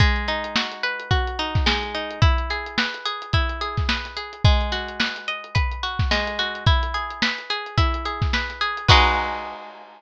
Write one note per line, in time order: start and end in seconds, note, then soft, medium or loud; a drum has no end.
0.00 1.66 G#3 medium
0.00 kick loud
0.00 closed hi-hat loud
0.16 closed hi-hat medium
0.28 1.39 D#4 medium
0.28 closed hi-hat medium
0.44 closed hi-hat medium
0.56 1.10 F#4 medium
0.56 snare loud
0.72 closed hi-hat medium
0.83 2.16 B4 medium
0.83 closed hi-hat medium
1.00 closed hi-hat medium
1.11 2.17 F#4 medium
1.11 kick medium
1.11 closed hi-hat medium
1.27 closed hi-hat medium
1.39 1.94 D#4 medium
1.39 closed hi-hat medium
1.55 kick medium
1.55 snare medium
1.55 closed hi-hat medium
1.66 2.19 G#3 medium
1.66 snare loud
1.83 closed hi-hat medium
1.95 2.21 D#4 medium
1.95 closed hi-hat medium
2.11 closed hi-hat medium
2.22 3.33 E4 medium
2.22 kick loud
2.22 closed hi-hat loud
2.38 closed hi-hat medium
2.50 3.05 G#4 medium
2.50 closed hi-hat medium
2.66 closed hi-hat medium
2.78 3.88 B4 medium
2.78 snare loud
2.94 closed hi-hat medium
3.05 3.61 G#4 medium
3.05 closed hi-hat medium
3.22 closed hi-hat medium
3.33 4.40 E4 medium
3.33 kick medium
3.33 closed hi-hat loud
3.49 closed hi-hat medium
3.61 4.16 G#4 medium
3.61 closed hi-hat medium
3.77 kick medium
3.77 snare soft
3.77 closed hi-hat medium
3.89 4.42 B4 medium
3.89 snare loud
4.05 snare soft
4.05 closed hi-hat medium
4.17 4.43 G#4 medium
4.17 closed hi-hat medium
4.33 closed hi-hat medium
4.44 6.11 G#3 medium
4.44 kick loud
4.44 closed hi-hat medium
4.61 closed hi-hat medium
4.72 5.83 F#4 medium
4.72 snare soft
4.72 closed hi-hat medium
4.88 closed hi-hat medium
5.00 5.54 B4 medium
5.00 snare loud
5.16 snare soft
5.16 closed hi-hat medium
5.28 6.61 D#5 medium
5.28 closed hi-hat medium
5.44 closed hi-hat medium
5.55 6.61 B4 medium
5.55 kick medium
5.55 closed hi-hat loud
5.72 closed hi-hat medium
5.83 6.38 F#4 medium
5.83 closed hi-hat medium
5.99 kick medium
5.99 snare medium
5.99 closed hi-hat medium
6.11 6.64 G#3 medium
6.11 snare loud
6.27 closed hi-hat medium
6.39 6.66 F#4 medium
6.39 snare soft
6.39 closed hi-hat medium
6.55 closed hi-hat medium
6.66 7.77 E4 medium
6.66 kick loud
6.66 closed hi-hat medium
6.83 closed hi-hat medium
6.94 7.50 G#4 medium
6.94 closed hi-hat medium
7.10 closed hi-hat medium
7.22 8.33 B4 medium
7.22 snare loud
7.38 closed hi-hat medium
7.50 8.05 G#4 medium
7.50 closed hi-hat medium
7.66 closed hi-hat medium
7.78 8.84 E4 medium
7.78 kick medium
7.78 closed hi-hat loud
7.94 closed hi-hat medium
8.05 8.61 G#4 medium
8.05 closed hi-hat medium
8.22 kick medium
8.22 snare medium
8.22 closed hi-hat medium
8.33 8.87 B4 medium
8.33 snare medium
8.50 snare soft
8.50 closed hi-hat medium
8.61 8.88 G#4 medium
8.61 closed hi-hat medium
8.77 closed hi-hat medium
8.88 10.02 G#3 loud
8.88 10.02 D#4 loud
8.88 10.02 F#4 loud
8.88 10.02 B4 loud
8.88 kick loud
8.88 crash loud